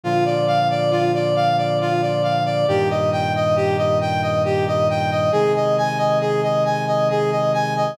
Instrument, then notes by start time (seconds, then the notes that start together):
brass section
0.03 A#2 D3 F3 F4
0.25 D5
0.47 F5
0.70 D5
0.91 F4
1.14 D5
1.36 F5
1.58 D5
1.81 F4
2.02 D5
2.23 F5
2.45 D5
2.68 G2 A#2 D#3 G4
2.90 D#5
3.12 G5
3.35 D#5
3.56 G4
3.78 D#5
4.01 G5
4.22 D#5
4.45 G4
4.67 D#5
4.90 G5
5.11 D#5
5.32 C3 D#3 G#3 G#4
5.56 D#5
5.78 G#5
5.98 D#5
6.21 G#4
6.43 D#5
6.65 G#5
6.88 D#5
7.10 G#4
7.31 D#5
7.54 G#5
7.76 D#5